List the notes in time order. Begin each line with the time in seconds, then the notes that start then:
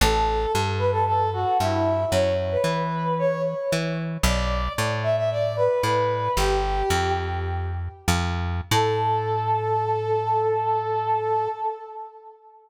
0.01 A1 A4
0.55 G2
0.78 B4
0.92 A4
1.07 A4
1.33 F#4
1.60 G2 E4
2.11 F#2 C#5
2.51 B4
2.64 E3
3.19 C#5
3.72 E3
4.23 B1 D5
4.78 A2
5.03 E5
5.17 E5
5.31 D5
5.57 B4
5.83 A2 B4
6.37 G1 G4
6.90 F2
8.08 F2
8.71 A2 A4